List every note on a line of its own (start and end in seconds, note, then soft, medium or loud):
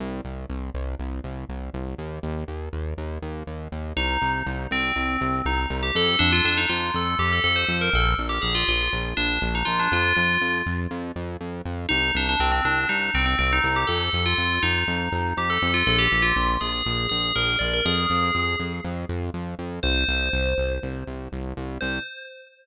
0.00 0.21 C2 loud
0.25 0.46 C2 medium
0.49 0.71 C2 medium
0.74 0.95 C2 medium
0.99 1.20 C2 medium
1.24 1.45 C2 medium
1.49 1.70 C2 medium
1.74 1.95 C2 medium
1.98 2.19 D#2 medium
2.23 2.44 D#2 medium
2.48 2.69 D#2 medium
2.73 2.94 D#2 medium
2.98 3.19 D#2 medium
3.22 3.43 D#2 medium
3.47 3.68 D#2 medium
3.72 3.93 D#2 medium
3.96 4.18 C2 loud
3.96 4.29 D#4 loud
4.21 4.43 C2 medium
4.46 4.67 C2 loud
4.71 4.92 C2 medium
4.71 5.33 C4 medium
4.96 5.17 C2 medium
5.21 5.42 C2 medium
5.45 5.66 C2 medium
5.45 5.58 D#4 loud
5.70 5.91 C2 loud
5.83 5.94 G4 medium
5.95 6.16 F2 loud
5.95 6.17 A4 loud
6.19 6.41 F2 loud
6.19 6.31 D4 loud
6.32 6.44 F4 loud
6.45 6.66 F2 medium
6.45 6.57 D4 medium
6.57 6.69 D#4 loud
6.69 6.91 F2 medium
6.69 6.90 F4 medium
6.94 7.15 F2 medium
6.94 7.16 A4 loud
7.19 7.40 F2 medium
7.19 7.31 G4 loud
7.33 7.43 A4 medium
7.44 7.65 F2 medium
7.44 7.56 A4 medium
7.56 7.77 C5 medium
7.68 7.89 F2 loud
7.81 7.93 A#4 loud
7.93 8.14 A#1 loud
7.93 8.07 A4 loud
8.18 8.39 A#1 medium
8.29 8.41 G4 loud
8.42 8.64 A#1 medium
8.42 8.54 G#4 loud
8.55 8.67 F4 loud
8.68 8.89 A#1 medium
8.68 8.91 F4 medium
8.93 9.14 A#1 loud
9.17 9.39 A#1 medium
9.17 9.41 D4 loud
9.42 9.63 A#1 loud
9.55 9.67 D#4 loud
9.65 9.88 A#1 medium
9.65 9.77 F4 loud
9.79 9.91 D4 loud
9.92 10.13 F2 loud
9.92 10.53 F4 loud
10.17 10.38 F2 medium
10.41 10.62 F2 medium
10.66 10.87 F2 medium
10.91 11.12 F2 loud
11.16 11.37 F2 medium
11.40 11.62 F2 medium
11.65 11.86 F2 medium
11.89 12.11 C2 loud
11.89 12.11 D#4 loud
12.15 12.36 C2 medium
12.15 12.28 D4 loud
12.29 12.41 D4 loud
12.40 12.61 C2 loud
12.40 12.51 C4 medium
12.52 12.64 C4 loud
12.65 12.86 C2 medium
12.65 12.88 D4 medium
12.89 13.10 C2 medium
12.89 13.10 D#4 medium
13.14 13.35 C2 medium
13.14 13.25 C4 medium
13.26 13.38 C4 medium
13.39 13.60 C2 medium
13.39 13.51 C4 loud
13.53 13.74 D#4 loud
13.64 13.85 C2 loud
13.76 13.88 G4 loud
13.87 14.10 F2 loud
13.87 14.21 A4 loud
14.13 14.34 F2 loud
14.26 14.62 F4 loud
14.38 14.59 F2 medium
14.63 14.84 F2 medium
14.63 15.27 D#4 loud
14.88 15.09 F2 medium
15.12 15.33 F2 medium
15.37 15.58 F2 medium
15.37 15.49 G4 medium
15.50 15.72 A4 loud
15.62 15.83 F2 loud
15.74 15.86 F4 loud
15.87 16.08 A#1 loud
15.87 15.99 A4 loud
15.99 16.22 G4 loud
16.12 16.33 A#1 medium
16.22 16.34 F4 loud
16.36 16.57 A#1 medium
16.36 16.49 F4 medium
16.61 16.82 A#1 medium
16.61 17.06 G#4 medium
16.86 17.07 A#1 loud
17.09 17.32 A#1 medium
17.09 17.32 G#4 medium
17.35 17.57 A#1 loud
17.35 17.58 A#4 loud
17.59 17.81 A#1 medium
17.59 17.71 D5 loud
17.73 17.85 A#4 medium
17.85 18.06 F2 loud
17.85 18.53 G#4 loud
18.10 18.31 F2 medium
18.35 18.56 F2 medium
18.59 18.80 F2 medium
18.84 19.05 F2 loud
19.09 19.30 F2 medium
19.34 19.55 F2 medium
19.59 19.80 F2 medium
19.83 20.05 C2 loud
19.83 20.71 C5 loud
20.08 20.29 C2 loud
20.33 20.54 C2 medium
20.58 20.79 C2 medium
20.83 21.04 C2 medium
21.07 21.28 C2 medium
21.32 21.53 C2 medium
21.57 21.78 C2 loud
21.81 21.99 C2 loud
21.81 21.98 C5 loud